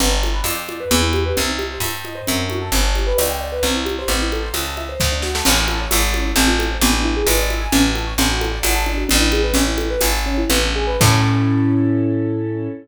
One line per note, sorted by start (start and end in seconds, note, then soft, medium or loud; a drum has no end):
0.00 0.41 G1 medium
0.00 0.10 B3 loud
0.00 low conga loud
0.11 0.21 D4 medium
0.23 0.34 A4 medium
0.23 high conga medium
0.33 0.43 B4 medium
0.44 0.85 F2 medium
0.44 0.56 D5 medium
0.44 tambourine medium
0.44 high conga medium
0.56 0.66 G5 medium
0.68 0.78 D5 medium
0.68 high conga medium
0.80 0.90 B4 medium
0.91 1.33 E2 loud
0.91 1.01 B3 loud
0.91 low conga medium
1.01 1.11 E4 medium
1.13 1.24 G4 medium
1.13 high conga medium
1.26 1.36 B4 medium
1.37 1.78 C2 medium
1.37 1.48 C4 medium
1.37 low conga loud
1.49 1.59 D#4 medium
1.59 1.69 G4 medium
1.59 high conga medium
1.71 1.81 C5 medium
1.80 2.21 G2 medium
1.80 1.93 E5 medium
1.80 tambourine medium
1.80 high conga medium
1.93 2.04 G5 medium
2.05 2.15 D#5 medium
2.05 high conga medium
2.15 2.25 C5 medium
2.27 2.70 F#2 medium
2.27 2.38 C4 medium
2.27 low conga medium
2.40 2.50 D4 medium
2.50 2.60 F#4 medium
2.50 high conga medium
2.61 2.71 A4 medium
2.72 3.13 G1 medium
2.72 2.83 B3 loud
2.72 low conga medium
2.83 2.94 D4 medium
2.95 3.07 G4 medium
2.95 high conga medium
3.07 3.17 B4 medium
3.18 3.60 C#2 medium
3.18 3.28 D5 medium
3.18 tambourine medium
3.18 high conga medium
3.29 3.40 G5 medium
3.41 3.51 D5 medium
3.52 3.62 B4 medium
3.63 4.05 C2 medium
3.63 3.74 C4 loud
3.63 low conga medium
3.75 3.85 E4 medium
3.85 3.95 G4 medium
3.85 high conga medium
3.99 4.09 C5 medium
4.08 4.49 A1 medium
4.08 4.20 C4 medium
4.08 low conga medium
4.22 4.32 E4 medium
4.32 4.43 A4 medium
4.32 high conga medium
4.43 4.53 C5 medium
4.54 4.95 C#2 medium
4.54 4.65 E5 medium
4.54 tambourine medium
4.54 high conga medium
4.65 4.75 A5 medium
4.77 4.87 E5 medium
4.77 high conga medium
4.89 4.99 C5 medium
5.00 5.42 D2 medium
5.00 5.10 C4 loud
5.00 kick medium
5.00 snare medium
5.12 5.22 D4 medium
5.22 5.33 F#4 medium
5.22 snare medium
5.35 5.45 A4 medium
5.35 snare loud
5.45 5.87 A1 medium
5.45 5.56 C#4 loud
5.45 crash loud
5.45 low conga loud
5.56 5.66 E4 medium
5.68 5.79 A4 medium
5.68 high conga medium
5.80 5.90 C#5 medium
5.91 6.33 G#1 medium
5.91 6.01 E5 medium
5.91 tambourine medium
5.91 high conga loud
6.02 6.12 A5 medium
6.14 6.24 C#4 medium
6.14 high conga medium
6.25 6.35 E4 medium
6.36 6.77 A1 loud
6.36 6.46 C4 medium
6.36 low conga medium
6.48 6.58 F4 medium
6.59 6.69 A4 medium
6.59 high conga medium
6.71 6.81 C5 medium
6.81 7.22 A1 loud
6.81 6.93 B3 medium
6.81 low conga loud
6.93 7.03 D4 medium
7.04 7.14 E4 medium
7.17 7.27 G#4 medium
7.26 7.67 G#1 medium
7.26 7.37 B4 medium
7.26 tambourine medium
7.26 high conga loud
7.38 7.48 D5 medium
7.50 7.60 E5 medium
7.50 high conga medium
7.61 7.71 G#5 medium
7.72 8.14 A1 medium
7.72 7.83 C#4 loud
7.72 low conga loud
7.85 7.95 F#4 medium
7.95 8.05 A4 medium
7.95 high conga medium
8.07 8.17 C#5 medium
8.18 8.59 A1 medium
8.18 8.29 D4 medium
8.18 low conga loud
8.30 8.40 F#4 medium
8.41 8.51 A4 medium
8.41 high conga medium
8.51 8.61 D5 medium
8.63 9.04 G#1 medium
8.63 8.73 F#5 medium
8.63 tambourine medium
8.63 high conga loud
8.75 8.85 A5 medium
8.86 8.96 D4 medium
8.86 high conga medium
8.97 9.08 F#4 medium
9.09 9.52 A1 loud
9.09 9.19 D4 loud
9.09 low conga loud
9.21 9.31 E4 medium
9.32 9.42 G#4 medium
9.32 high conga medium
9.43 9.53 B4 medium
9.54 9.96 A1 medium
9.54 9.65 C#4 loud
9.54 low conga loud
9.67 9.77 E4 medium
9.78 9.88 A4 medium
9.78 high conga medium
9.90 10.01 B4 medium
10.01 10.45 G#1 medium
10.01 10.11 E5 medium
10.01 tambourine medium
10.01 high conga medium
10.12 10.23 A5 medium
10.26 10.37 C#4 medium
10.38 10.49 E4 medium
10.50 10.97 A1 medium
10.50 10.61 B3 loud
10.50 low conga loud
10.63 10.75 D4 medium
10.76 10.87 G#4 medium
10.87 10.99 B4 medium
11.00 12.68 A2 loud
11.00 12.68 C#4 loud
11.00 12.68 E4 medium
11.00 12.68 A4 loud
11.00 kick loud
11.00 crash loud